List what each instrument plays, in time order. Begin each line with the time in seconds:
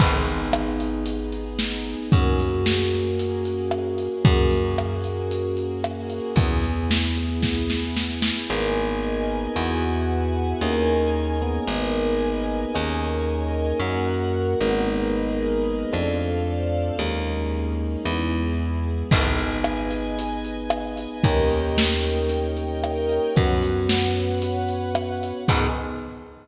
0.00 electric bass (finger) G#1, electric piano 1 B3 D#4 G#4, string ensemble 1 B3 D#4 G#4, kick, crash
0.27 closed hi-hat
0.53 cross-stick
0.80 closed hi-hat
1.06 closed hi-hat
1.32 closed hi-hat
1.59 snare
1.86 closed hi-hat
2.12 electric bass (finger) F#2, electric piano 1 A#3 C#4 F#4 G#4, string ensemble 1 A#3 C#4 F#4 G#4, kick, closed hi-hat
2.39 closed hi-hat
2.66 snare
2.92 closed hi-hat
3.19 closed hi-hat
3.45 closed hi-hat
3.71 cross-stick
3.98 closed hi-hat
4.24 electric bass (finger) F#2, string ensemble 1 A#3 C#4 F#4 G#4, electric piano 1 A#3 C#4 F#4 G#4, kick, closed hi-hat
4.51 closed hi-hat
4.78 cross-stick
5.04 closed hi-hat
5.31 closed hi-hat
5.57 closed hi-hat
5.84 cross-stick
6.10 closed hi-hat
6.36 electric bass (finger) E2, string ensemble 1 B3 E4 G#4, electric piano 1 B3 E4 G#4, kick, closed hi-hat
6.63 closed hi-hat
6.91 snare
7.17 closed hi-hat
7.43 kick, snare
7.70 snare
7.96 snare
8.22 snare
8.50 electric bass (finger) G#1, electric piano 1 A#3 B3 D#4 G#4, string ensemble 1 A#4 B4 D#5 G#5
9.56 electric bass (finger) E2, electric piano 1 B3 E4 F#4 G#4, string ensemble 1 B4 E5 F#5 G#5
10.61 electric bass (finger) D#2, electric piano 1 A#3 C#4 D#4 G#4, string ensemble 1 A#4 C#5 D#5 G#5
11.42 electric piano 1 A#3 B3 D#4 G#4
11.67 electric bass (finger) G#1, string ensemble 1 A#4 B4 D#5 G#5
12.74 electric bass (finger) D#2, electric piano 1 A#3 C#4 D#4 G#4, string ensemble 1 A#4 C#5 D#5 G#5
13.80 electric bass (finger) F#2, electric piano 1 A#3 C#4 F#4, string ensemble 1 A#4 C#5 F#5
14.60 electric bass (finger) G#1, electric piano 1 G#3 A#3 B3 D#4
14.87 string ensemble 1 G#4 A#4 B4 D#5
15.92 electric bass (finger) F2, electric piano 1 A3 C4 D4 F4, string ensemble 1 A4 C5 D5 F5
16.99 electric bass (finger) D#2, electric piano 1 G#3 A#3 C#4 D#4, string ensemble 1 A#3 C#4 D#4 G#4
18.05 electric bass (finger) E2, electric piano 1 G#3 B3 E4, string ensemble 1 B3 E4 G#4
19.11 electric bass (finger) G#1, electric piano 1 B3 D#4 G#4, string ensemble 1 B4 D#5 G#5, kick, crash
19.38 closed hi-hat
19.64 cross-stick
19.91 closed hi-hat
20.19 closed hi-hat
20.45 closed hi-hat
20.70 cross-stick
20.97 closed hi-hat
21.23 electric bass (finger) D#2, electric piano 1 A#3 C#4 D#4 G4, string ensemble 1 A#4 C#5 D#5 G5, kick, closed hi-hat
21.50 closed hi-hat
21.78 snare
22.03 closed hi-hat
22.29 closed hi-hat
22.57 closed hi-hat
22.84 cross-stick
23.09 closed hi-hat
23.35 electric bass (finger) F#2, electric piano 1 B3 C#4 F#4, string ensemble 1 B4 C#5 F#5, kick, closed hi-hat
23.63 closed hi-hat
23.89 snare
24.17 closed hi-hat
24.42 closed hi-hat
24.68 closed hi-hat
24.95 cross-stick
25.23 closed hi-hat
25.48 electric bass (finger) G#2, electric piano 1 B3 D#4 G#4, string ensemble 1 B3 D#4 G#4, kick, crash